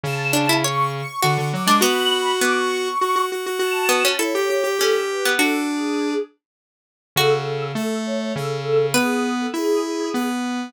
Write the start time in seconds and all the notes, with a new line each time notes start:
0.03 C#3 A5
0.33 D4
0.49 E4
0.63 C#5 C#6
0.93 C#6
1.22 D3 F#4 C#6
1.38 D3
1.53 F#3 D6
1.67 G#3 D4
1.81 B3 F#4 B5
2.41 B3 D6
2.56 C#6
3.01 F#4
3.16 F#4
3.32 F#4
3.46 F#4
3.59 F#4 A5
3.89 B3
4.05 C#4
4.19 E4 A4 C#5
4.35 G4
4.50 G4
4.64 G4
4.79 C#4 G4 A4
5.09 B4
5.25 B3
5.38 D4 F#4 A4
5.68 G#4
7.16 C#3 F#4 A4
7.75 A3
8.06 C#5
8.36 C#3 A4
8.94 B3 G#4 B4
9.40 A4
9.54 E4 G#4
10.14 B3